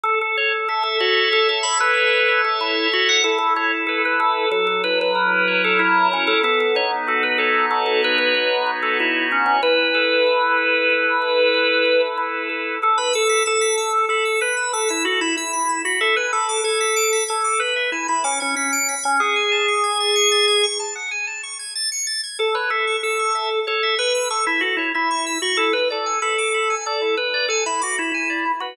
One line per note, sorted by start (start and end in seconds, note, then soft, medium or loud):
0.03 0.19 A4 loud
0.03 2.60 A4 medium
0.21 0.37 A4 loud
0.37 0.53 C#5 loud
0.68 0.83 A4 loud
0.68 1.96 E5 medium
0.83 0.99 A4 loud
1.00 1.28 F#4 loud
1.00 1.64 C#5 medium
1.33 1.48 A4 loud
1.49 1.64 A4 loud
1.63 2.28 C#5 medium
1.63 1.78 B5 loud
1.80 2.41 B4 loud
1.97 3.18 E5 medium
2.28 2.91 C#5 medium
2.45 2.60 A4 loud
2.61 2.87 E4 medium
2.61 3.21 A4 medium
2.92 3.09 F#4 loud
2.92 3.22 C#5 medium
3.09 3.24 F#5 loud
3.24 4.45 E4 medium
3.24 3.38 A4 loud
3.38 3.54 A4 loud
3.56 4.47 A4 medium
3.56 3.71 C#5 loud
3.87 4.02 A4 loud
3.87 4.49 B4 medium
4.05 4.20 B4 loud
4.20 4.49 A4 loud
4.51 6.33 F#3 medium
4.51 4.66 A4 loud
4.67 4.82 A4 loud
4.84 6.11 E4 medium
4.84 4.99 B4 loud
5.01 5.62 B4 loud
5.15 5.79 A#4 medium
5.48 6.39 C#5 medium
5.64 5.80 A4 loud
5.79 6.08 E4 loud
5.79 6.40 A#4 medium
6.11 6.28 C#4 loud
6.11 6.42 E4 medium
6.27 6.42 A4 loud
6.43 8.34 B3 medium
6.43 6.59 A4 loud
6.60 6.75 A4 loud
6.75 8.02 D#4 medium
6.75 6.91 C#5 loud
7.07 7.71 F#4 medium
7.07 7.23 A4 loud
7.23 7.38 B4 loud
7.38 7.66 A4 loud
7.38 9.30 C#5 medium
7.71 8.99 F#4 medium
7.71 7.86 A4 loud
7.86 8.01 A4 loud
8.03 8.66 D#4 medium
8.03 8.18 B4 loud
8.18 8.71 B4 loud
8.35 9.56 B3 medium
8.66 9.57 D#4 medium
8.83 8.98 A4 medium
8.99 9.27 E4 loud
8.99 9.60 F#4 medium
9.31 9.45 C#4 medium
9.31 9.61 C#5 medium
9.46 9.61 C#4 loud
9.62 10.89 E4 medium
9.62 12.01 B4 loud
9.94 10.57 A4 medium
10.27 11.54 B4 medium
10.58 11.21 A4 medium
10.90 12.17 E4 medium
11.22 11.85 A4 medium
11.54 12.76 B4 medium
11.86 12.49 A4 medium
12.18 12.78 E4 medium
12.49 12.80 A4 medium
12.83 12.98 A4 loud
12.98 13.13 B4 loud
12.98 13.12 B5 medium
13.13 13.43 A4 loud
13.13 13.28 E6 medium
13.29 13.44 B6 medium
13.46 14.05 A4 loud
13.46 13.60 E7 medium
13.61 13.76 B6 medium
13.77 13.92 E6 medium
13.93 14.08 A4 medium
14.09 14.40 A4 loud
14.09 14.24 B5 medium
14.25 14.40 E6 medium
14.41 14.72 B4 loud
14.41 14.55 B6 medium
14.57 14.71 E7 medium
14.73 14.88 A4 loud
14.73 14.88 B6 medium
14.89 15.05 E4 medium
14.89 15.03 E6 medium
15.05 15.20 F#4 loud
15.05 15.20 A4 medium
15.21 15.36 E4 loud
15.21 15.36 B5 medium
15.36 15.82 E4 medium
15.36 15.52 E6 medium
15.53 15.67 B6 medium
15.69 15.83 E7 medium
15.85 16.00 F#4 medium
15.85 15.99 B6 medium
16.01 16.16 A4 loud
16.01 16.15 E5 medium
16.16 16.32 B4 loud
16.16 16.31 G#5 medium
16.33 16.61 A4 loud
16.33 16.47 B5 medium
16.49 16.63 D6 medium
16.64 17.24 A4 loud
16.64 16.79 G#6 medium
16.80 16.95 B6 medium
16.96 17.11 D7 medium
17.13 17.27 B6 medium
17.28 17.61 A4 loud
17.28 17.43 G#6 medium
17.44 17.59 D6 medium
17.60 17.90 B4 medium
17.60 17.74 B5 medium
17.76 17.90 E5 medium
17.92 18.07 E4 medium
17.92 18.07 G#5 medium
18.08 18.24 E4 loud
18.08 18.22 B5 medium
18.24 18.39 C#4 loud
18.24 18.38 D6 medium
18.40 18.55 C#4 loud
18.40 18.54 G#6 medium
18.55 18.95 C#4 loud
18.55 18.71 B6 medium
18.73 18.87 D7 medium
18.89 19.03 B6 medium
19.03 19.20 C#4 loud
19.03 19.18 G#6 medium
19.20 20.66 G#4 loud
19.20 19.34 F#5 medium
19.36 19.50 G#5 medium
19.52 19.66 A5 medium
19.68 19.82 C#6 medium
19.84 19.98 G#6 medium
20.00 20.15 A6 medium
20.16 20.30 C#7 medium
20.32 20.46 A6 medium
20.48 20.62 G#6 medium
20.63 20.78 C#6 medium
20.80 20.94 A5 medium
20.95 21.10 F#5 medium
21.11 21.26 G#5 medium
21.27 21.41 A5 medium
21.43 21.58 C#6 medium
21.59 21.74 G#6 medium
21.75 21.90 A6 medium
21.92 22.06 C#7 medium
22.07 22.21 A6 medium
22.23 22.38 G#6 medium
22.40 22.55 A4 loud
22.55 22.70 B4 loud
22.55 22.69 C#5 medium
22.70 22.96 A4 loud
22.70 22.85 E5 medium
22.87 23.02 C#6 medium
23.03 23.60 A4 loud
23.03 23.18 E6 medium
23.19 23.34 C#6 medium
23.35 23.49 E5 medium
23.51 23.65 A4 medium
23.67 23.95 A4 loud
23.67 23.81 C#5 medium
23.83 23.97 E5 medium
23.99 24.28 B4 loud
23.99 24.13 C#6 medium
24.15 24.29 E6 medium
24.30 24.46 A4 medium
24.30 24.45 C#6 medium
24.46 24.62 E4 loud
24.46 24.61 E5 medium
24.61 24.76 F#4 loud
24.61 24.77 A4 medium
24.77 24.92 E4 loud
24.77 24.93 C#5 medium
24.94 25.38 E4 loud
24.94 25.09 E5 medium
25.11 25.25 C#6 medium
25.26 25.41 E6 medium
25.42 25.57 F#4 loud
25.42 25.57 C#6 medium
25.57 25.73 E4 medium
25.57 25.72 A4 loud
25.73 25.88 B4 loud
25.90 26.19 A4 medium
25.90 26.05 D5 medium
26.06 26.20 G#5 medium
26.22 26.75 A4 loud
26.22 26.36 B5 medium
26.38 26.53 D6 medium
26.54 26.68 B5 medium
26.70 26.84 G#5 medium
26.86 27.15 A4 loud
26.86 27.00 D5 medium
27.02 27.16 E4 medium
27.17 27.46 B4 loud
27.34 27.48 D5 medium
27.48 27.64 A4 medium
27.48 27.64 G#5 medium
27.66 27.81 E4 loud
27.66 27.80 B5 medium
27.82 27.98 F#4 medium
27.82 27.96 D6 medium
27.98 28.11 E4 loud
27.98 28.12 B5 medium
28.12 28.52 E4 medium
28.12 28.29 G#5 medium
28.30 28.44 D5 medium
28.45 28.60 E4 medium
28.60 28.76 F#4 loud
28.60 28.76 B4 medium